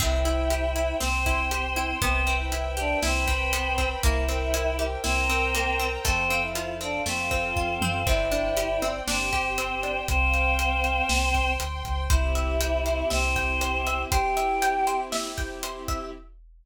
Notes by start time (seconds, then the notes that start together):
0.00 C2 C4 E4 C5 E5 G5, kick, crash
0.25 E4, closed hi-hat
0.50 G4, closed hi-hat
0.76 E4, closed hi-hat
1.00 C2 C4 C5 G5 C6, snare
1.26 E4, kick, closed hi-hat
1.51 G4, closed hi-hat
1.76 E4, closed hi-hat
2.01 C2 B3 C4 B4 C5 E5 G5, kick, closed hi-hat
2.27 C4, closed hi-hat
2.40 E4 E5
2.52 E4, closed hi-hat
2.77 D4 G4 D5, closed hi-hat
3.02 C2 C4 E4 B4 C5 G5 B5, snare
3.28 C4, kick, closed hi-hat
3.53 B3, closed hi-hat
3.78 C4, kick, closed hi-hat
4.03 C2 A#3 E4 A#4 C5 E5 G5, kick, closed hi-hat
4.28 C4, closed hi-hat
4.54 E4, closed hi-hat
4.79 G4, closed hi-hat
5.04 C2 C4 E4 A#4 C5 G5 A#5, snare
5.30 C4, closed hi-hat
5.55 A#3, closed hi-hat
5.79 C4, closed hi-hat
6.05 F2 A3 C4 A4 C5 F5, kick, closed hi-hat
6.30 C4, closed hi-hat
6.42 E4 E5
6.55 F4, closed hi-hat
6.81 C4 D4 D5, closed hi-hat
7.06 F2 A3 C4 F4 A4 C5 F5, snare
7.31 C4, kick, closed hi-hat
7.56 F2 F4, kick
7.82 F#2 C4, high tom
8.07 G1 C4 E4 C5 D5 E5 G5, kick, crash
8.32 D4, closed hi-hat
8.57 G4, closed hi-hat
8.82 C4, closed hi-hat
9.07 G1 C4 D4 G4 C5 G5, snare
9.33 G4, kick, closed hi-hat
9.58 C4, closed hi-hat
9.83 D4, closed hi-hat
10.08 C2 C4 C5 F5 G5, kick, closed hi-hat
10.34 closed hi-hat
10.59 closed hi-hat
10.84 closed hi-hat
11.09 C2 C5 G5 C6, snare
11.34 kick, closed hi-hat
11.60 D2, closed hi-hat
11.85 C#2, kick, closed hi-hat
12.10 C2 C4 E4 G4 C5 E5, kick, closed hi-hat
12.35 E5, closed hi-hat
12.61 G5, closed hi-hat
12.86 C5, closed hi-hat
13.10 C2 C4 C5 E5, snare
13.36 G5, kick, closed hi-hat
13.61 C5, closed hi-hat
13.87 E5, closed hi-hat
14.10 C4 E4 G4 C5 G5, kick, closed hi-hat
14.37 E5, closed hi-hat
14.62 G5, closed hi-hat
14.87 C5, closed hi-hat
15.12 E5, snare
15.38 G5, kick, closed hi-hat
15.63 C5, closed hi-hat
15.88 E5, kick, closed hi-hat